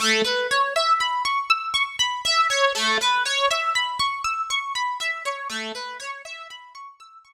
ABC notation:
X:1
M:4/4
L:1/16
Q:1/4=60
K:A
V:1 name="Orchestral Harp"
A, B c e b c' e' c' b e c A, B c e b | c' e' c' b e c A, B c e b c' e' c' z2 |]